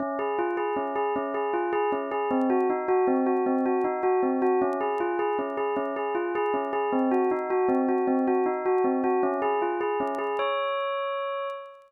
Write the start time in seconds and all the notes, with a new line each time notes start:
0.00 C#4
0.19 G#4
0.39 F4
0.57 G#4
0.76 C#4
0.96 G#4
1.16 C#4
1.34 G#4
1.53 F4
1.73 G#4
1.92 C#4
2.11 G#4
2.31 C4
2.50 F#4
2.70 D#4
2.88 F#4
3.07 C4
3.26 F#4
3.46 C4
3.66 F#4
3.84 D#4
4.03 F#4
4.23 C4
4.42 F#4
4.62 C#4
4.81 G#4
5.00 F4
5.19 G#4
5.39 C#4
5.57 G#4
5.77 C#4
5.96 G#4
6.15 F4
6.35 G#4
6.54 C#4
6.73 G#4
6.92 C4
7.11 F#4
7.31 D#4
7.50 F#4
7.69 C4
7.89 F#4
8.07 C4
8.27 F#4
8.46 D#4
8.66 F#4
8.84 C4
9.04 F#4
9.23 C#4
9.42 G#4
9.62 F4
9.81 G#4
10.00 C#4
10.19 G#4
10.39 C#5